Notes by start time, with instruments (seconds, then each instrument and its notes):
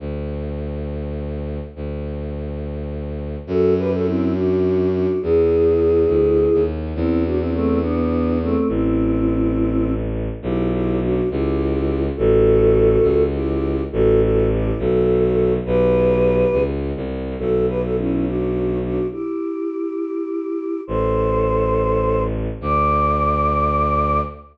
0.00 violin D2
1.76 violin D2
3.47 violin F#2, choir aahs F#4 A4
3.78 choir aahs G4 B4
3.92 choir aahs F#4 A4
4.05 choir aahs C4 E4
4.35 choir aahs D4 F#4
4.92 choir aahs D4 F#4
5.22 violin E2, choir aahs E4 G#4
6.08 violin D2
6.54 violin D#2
6.95 violin E2, choir aahs C4 E4
7.25 choir aahs D4 F#4
7.39 choir aahs C4 E4
7.53 choir aahs A3 C4
7.81 choir aahs B3 D4
8.42 choir aahs A3 C4
8.68 violin A1, choir aahs C4 E4
10.42 violin B1, choir aahs E4 G4
10.72 choir aahs E4 G4
11.02 choir aahs D4 F#4
11.30 violin C#2, choir aahs E4 G4
12.16 violin A1, choir aahs F#4 A4
13.02 violin C#2
13.34 choir aahs E4 G4
13.92 violin A1, choir aahs F#4 A4
14.21 choir aahs F#4 A4
14.50 choir aahs E4 G4
14.79 violin B1, choir aahs F#4 A4
15.66 violin B1, choir aahs G4 B4
16.52 violin C#2
16.96 violin C2
17.38 violin B1, choir aahs F#4 A4
17.68 choir aahs G4 B4
17.83 choir aahs F#4 A4
17.97 choir aahs C#4 E4
18.25 choir aahs D4 F#4
18.83 choir aahs D4 F#4
19.12 choir aahs E4 G4
20.87 violin A1, choir aahs A4 C5
22.61 violin D2, choir aahs D5